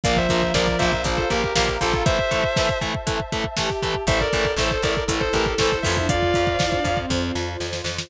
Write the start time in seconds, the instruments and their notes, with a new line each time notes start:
0.03 electric bass (finger) A#1, overdriven guitar F3 A#3, violin F3, distortion guitar D5 F5, pad 2 (warm) F5 A#5, kick, closed hi-hat
0.16 distortion guitar C5 E5, kick
0.29 electric bass (finger) A#1, overdriven guitar F3 A#3, kick, closed hi-hat
0.42 kick
0.54 electric bass (finger) A#1, overdriven guitar F3 A#3, distortion guitar A#4 D5, kick, snare
0.68 kick
0.78 electric bass (finger) A#1, overdriven guitar F3 A#3, distortion guitar C5 E5, kick, closed hi-hat
0.93 kick
1.04 electric bass (finger) A#1, overdriven guitar F3 A#3, violin F4, kick, closed hi-hat
1.17 distortion guitar A4 C5, kick
1.30 electric bass (finger) A#1, overdriven guitar F3 A#3, distortion guitar G4 A#4, kick, closed hi-hat
1.44 kick
1.55 electric bass (finger) A#1, overdriven guitar F3 A#3, distortion guitar G4 A#4, kick, snare
1.68 kick
1.81 electric bass (finger) A#1, overdriven guitar F3 A#3, distortion guitar F4 A4, kick, closed hi-hat
1.93 kick
2.05 overdriven guitar E3 A3, distortion guitar C5 E5, pad 2 (warm) E5 A5, kick, closed hi-hat
2.19 kick
2.31 overdriven guitar E3 A3, kick, closed hi-hat
2.44 kick
2.56 overdriven guitar E3 A3, kick, snare
2.69 kick
2.81 overdriven guitar E3 A3, kick, closed hi-hat
2.95 kick
3.07 overdriven guitar E3 A3, kick, closed hi-hat
3.20 kick
3.32 overdriven guitar E3 A3, kick, closed hi-hat
3.44 kick
3.57 overdriven guitar E3 A3, violin G4, kick, snare
3.70 kick
3.82 overdriven guitar E3 A3, kick, closed hi-hat
3.94 kick
4.07 electric bass (finger) A1, overdriven guitar E3 A3, pad 2 (warm) E4 A4, violin A4, distortion guitar C5 E5, kick, closed hi-hat
4.20 distortion guitar A#4 D5, kick
4.33 electric bass (finger) A1, overdriven guitar E3 A3, kick, closed hi-hat
4.45 kick
4.57 electric bass (finger) A1, overdriven guitar E3 A3, distortion guitar A4 C5, kick, snare
4.71 kick
4.82 electric bass (finger) A1, overdriven guitar E3 A3, distortion guitar A#4 D5, kick, closed hi-hat
4.97 kick
5.08 electric bass (finger) A1, overdriven guitar E3 A3, violin A4, kick, closed hi-hat
5.20 distortion guitar A4 C5, kick
5.33 electric bass (finger) A1, overdriven guitar E3 A3, distortion guitar G4 A#4, kick, closed hi-hat
5.46 kick
5.58 electric bass (finger) A1, overdriven guitar E3 A3, distortion guitar A4 C5, kick, snare
5.72 kick
5.82 electric bass (finger) F2, overdriven guitar E3 A3, violin F4, distortion guitar C5 E5, kick, open hi-hat
5.97 violin D4, kick
6.09 pad 2 (warm) F4 C5, violin F4, distortion guitar D5 F5, kick, closed hi-hat
6.22 kick
6.34 electric bass (finger) F2, kick, closed hi-hat
6.47 kick
6.59 electric bass (finger) F2, violin E4, kick, snare
6.72 violin D4, kick
6.84 electric bass (finger) F2, kick, closed hi-hat
6.97 violin C4, kick
7.10 electric bass (finger) F2, kick, snare
7.35 electric bass (finger) F2, snare
7.60 electric bass (finger) F2, snare
7.73 snare
7.84 electric bass (finger) F2, snare
7.98 snare